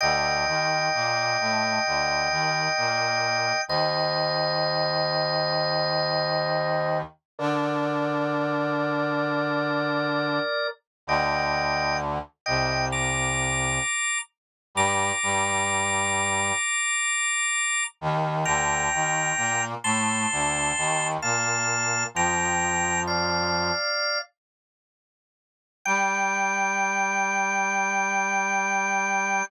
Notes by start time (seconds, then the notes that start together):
0.01 D2 D3 D#5 G5
0.47 D#2 D#3
0.94 A#2 A#3
1.40 A2 A3
1.86 D2 D3
2.31 D#2 D#3
2.77 A#2 A#3
3.68 D#2 D#3 C5 D#5
7.38 D3 D4 A#4 D5
11.07 D2 D3 D#5 G5
12.46 C2 C3 D#5 G5
12.92 A#5 D6
14.75 G2 G3 A#5 D6
15.23 G2 G3
18.01 D#2 D#3
18.45 D2 D3 G5 A#5
18.93 D#2 D#3
19.37 A#2 A#3
19.84 A2 A3 A5 C6
20.31 D2 D3
20.77 D#2 D#3
21.22 A#2 A#3 F5 A5
22.14 F2 F3 G5 A#5
23.07 D5 F5
25.85 G3 G5